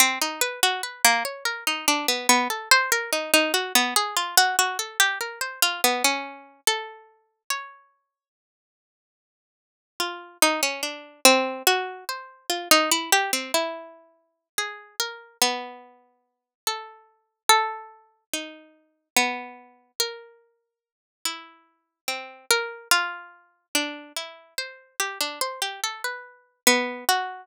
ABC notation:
X:1
M:6/8
L:1/16
Q:3/8=48
K:none
V:1 name="Harpsichord"
C ^D B ^F B ^A, ^c ^A D =D B, B, | A c ^A ^D D ^F B, ^G =F ^F F =A | G ^A c F B, ^C3 =A4 | ^c12 |
F2 ^D ^C =D2 =C2 ^F2 c2 | F ^D E G C E5 ^G2 | ^A2 B,6 =A4 | A4 ^D4 B,4 |
^A6 E4 C2 | ^A2 F4 D2 E2 c2 | G D c G A B3 B,2 ^F2 |]